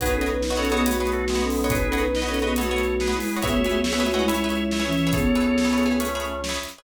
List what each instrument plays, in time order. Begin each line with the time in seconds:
0.00 drawbar organ B1 G#4 B4, flute D#4 B4, pizzicato strings F#4 B4 C#5 D#5, kick, closed hi-hat
0.14 flute C#4 A4
0.21 pizzicato strings F#4 B4 C#5 D#5, closed hi-hat
0.29 flute D#4 B4
0.42 flute D#4 B4, snare
0.50 pizzicato strings F#4 B4 C#5 D#5
0.57 flute C#4 A4, pizzicato strings F#4 B4 C#5 D#5, drawbar organ A4 C#5
0.65 closed hi-hat
0.71 flute B3 G#4, pizzicato strings F#4 B4 C#5 D#5
0.86 flute A3 F#4, pizzicato strings F#4 B4 C#5 D#5, closed hi-hat
1.00 pizzicato strings F#4 B4 C#5 D#5, drawbar organ G#4 B4
1.07 closed hi-hat
1.13 drawbar organ F#4 A4
1.28 drawbar organ G#3 B3, snare
1.35 pizzicato strings F#4 B4 C#5 D#5
1.42 flute C#4 A4
1.50 open hi-hat
1.64 pizzicato strings F#4 B4 C#5 D#5
1.70 flute D#4 B4, drawbar organ G#4 B4, kick, closed hi-hat
1.86 flute C#4 A4
1.92 pizzicato strings F#4 B4 C#5 D#5, closed hi-hat
2.01 flute D#4 B4
2.14 flute D#4 B4, drawbar organ B4 D#5, snare
2.22 pizzicato strings F#4 B4 C#5 D#5
2.28 flute C#4 A4, pizzicato strings F#4 B4 C#5 D#5
2.34 closed hi-hat
2.42 flute B3 G#4, pizzicato strings F#4 B4 C#5 D#5, drawbar organ B4 D#5
2.56 flute A3 F#4, pizzicato strings F#4 B4 C#5 D#5, drawbar organ A4 C#5, closed hi-hat
2.71 pizzicato strings F#4 B4 C#5 D#5
2.78 closed hi-hat
3.00 drawbar organ G#4 B4, snare
3.07 pizzicato strings F#4 B4 C#5 D#5
3.14 flute G#3 E4
3.20 open hi-hat
3.36 pizzicato strings F#4 B4 C#5 D#5
3.42 drawbar organ C#2 C#5 E5, flute B3 G#4, pizzicato strings G#4 B4 C#5 E5, kick, closed hi-hat
3.57 flute A3 F#4
3.64 pizzicato strings G#4 B4 C#5 E5, closed hi-hat
3.72 flute B3 G#4
3.84 flute B3 G#4, drawbar organ C#5 E5, snare
3.93 pizzicato strings G#4 B4 C#5 E5
4.00 flute A3 F#4, pizzicato strings G#4 B4 C#5 E5
4.06 closed hi-hat
4.14 flute G#3 E4, pizzicato strings G#4 B4 C#5 E5, drawbar organ D#5 F#5
4.28 flute G#3 E4, pizzicato strings G#4 B4 C#5 E5, drawbar organ C#5 E5, closed hi-hat
4.44 pizzicato strings G#4 B4 C#5 E5
4.50 closed hi-hat
4.71 drawbar organ C#5 E5, snare
4.79 pizzicato strings G#4 B4 C#5 E5
4.86 flute E3 C#4
4.93 closed hi-hat
5.07 pizzicato strings G#4 B4 C#5 E5
5.13 flute B3 G#4, drawbar organ A4 C#5, kick, closed hi-hat
5.35 pizzicato strings G#4 B4 C#5 E5, closed hi-hat
5.58 snare
5.65 pizzicato strings G#4 B4 C#5 E5
5.73 pizzicato strings G#4 B4 C#5 E5
5.78 closed hi-hat
5.86 pizzicato strings G#4 B4 C#5 E5
6.00 drawbar organ A3 C#4, pizzicato strings G#4 B4 C#5 E5, closed hi-hat
6.15 pizzicato strings G#4 B4 C#5 E5
6.20 closed hi-hat
6.44 snare
6.49 pizzicato strings G#4 B4 C#5 E5
6.63 closed hi-hat
6.78 pizzicato strings G#4 B4 C#5 E5